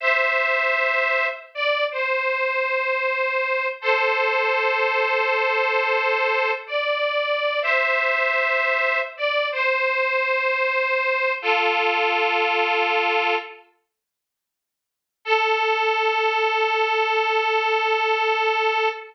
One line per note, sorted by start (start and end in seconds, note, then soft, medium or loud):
0.00 1.27 C5 medium
0.00 1.27 E5 medium
1.55 1.85 D5 medium
1.91 3.67 C5 medium
3.81 6.51 A4 medium
3.81 6.51 C5 medium
6.67 7.60 D5 medium
7.62 9.00 C5 medium
7.62 9.00 E5 medium
9.17 9.48 D5 medium
9.52 11.33 C5 medium
11.42 13.35 F4 medium
11.42 13.35 A4 medium
15.25 18.89 A4 loud